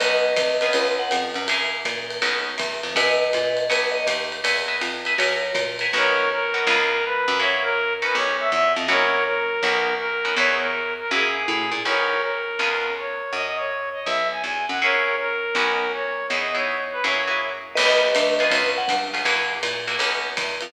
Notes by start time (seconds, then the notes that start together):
0.00 B1 B3 C#4 D#4 F#4 B4 D#5, ride
0.36 C2, kick, hi-hat pedal, ride
0.61 B3 C#4 F4 G#4, ride
0.73 C#2 B4, ride
0.99 F#5
1.11 F2, hi-hat pedal, ride
1.34 F#2, ride
1.48 A#3 E4 F#4 G#4, ride
1.85 A#2, kick, hi-hat pedal, ride
2.10 ride
2.22 B1 B3 C#4 D#4 F#4, ride
2.58 E2, kick, hi-hat pedal, ride
2.83 F2, ride
2.95 F#2 A#4 B4 D#5 E5 F#5 G#5, kick, ride
3.33 A#2, hi-hat pedal, ride
3.57 ride
3.70 B1 B4 C#5 D#5 F#5, ride
3.92 D#5
4.07 D#2, hi-hat pedal, ride
4.32 ride
4.44 E2 B4 D#5 E5 G#5, ride
4.68 B4 D#5 E5 G#5
4.81 F2, hi-hat pedal, ride
5.05 B4 D#5 E5 G#5, ride
5.18 F#2 A#4 C#5 E5 F#5 G#5, ride
5.54 A#2, kick, hi-hat pedal, ride
5.79 A#4 E5 F#5 G#5, ride
5.93 B1 B3 C#4 D#4 F#4 A#4 C#5
6.32 A#4
6.54 B3 C#4 D#4 F#4
6.67 C#2 B3 C#4 F4 G#4
7.05 B4
7.28 F#2
7.40 A#3 E4 F#4 G#4 C#5
7.63 A#4
8.02 B3 C#4 D#4 F#4 B4
8.15 B1 C#5
8.40 E5
8.51 E2 E5
8.76 F2 D#5
8.88 F#2 A#3 E4 F#4 G#4 A#4 C#5
9.26 A#4
9.63 B1 B3 C#4 D#4 F#4
9.99 A#4
10.25 B3 C#4 D#4 F#4
10.36 E2 B3 D#4 E4 G#4 C#5
10.61 A#4
11.00 A#4
11.11 F#2 A#3 E4 F#4 G#4
11.48 A2
11.71 A#2
11.85 B1 B3 C#4 D#4 F#4 A#4 C#5
12.23 A#4
12.59 C#2 B3 C#4 F4 G#4
12.99 C#5
13.33 F#2 D#5
13.57 C#5
13.93 D#5
14.06 B1 E5
14.31 G#5
14.43 E2 G#5
14.69 F#2 F#5
14.82 A#3 E4 F#4 G#4 A#4 C#5
15.19 A#4
15.55 B1 B3 C#4 D#4 F#4
15.94 C#5
16.29 E2 B3 D#4 E4 G#4 D#5
16.55 B3 D#4 E4 G#4 C#5
16.92 B4
17.04 F#2 A#3 E4 F#4 G#4 C#5
17.27 A#3 E4 F#4 G#4
17.75 B1 B3 C#4 D#4 F#4 B4 D#5, crash, ride
18.15 D2, hi-hat pedal, ride
18.39 B3 C#4 F4 G#4, ride
18.50 C#2 B4, kick, ride
18.78 F#5
18.88 G2, kick, hi-hat pedal, ride
19.14 B3 C#4 F4 G#4, ride
19.25 F#2 A#3 E4 F#4 G#4, ride
19.63 A#2, hi-hat pedal, ride
19.87 A#3 E4 F#4 G#4, ride
19.99 B1 B3 C#4 D#4 F#4, ride
20.37 E2, kick, hi-hat pedal, ride
20.61 F2, ride